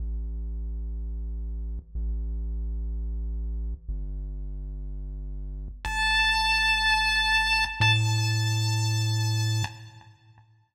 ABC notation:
X:1
M:4/4
L:1/8
Q:1/4=123
K:Am
V:1 name="Lead 1 (square)"
z8 | z8 | z8 | a8 |
a8 |]
V:2 name="Synth Bass 1" clef=bass
A,,,8 | A,,,8 | G,,,8 | G,,,8 |
A,,8 |]